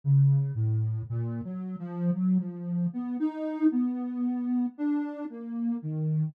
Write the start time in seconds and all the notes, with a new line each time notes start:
0.04 C#3
0.55 A2
1.10 A#2
1.45 F#3
1.79 F3
2.14 F#3
2.39 F3
2.93 B3
3.20 D#4
3.71 B3
4.78 D4
5.30 A#3
5.82 D#3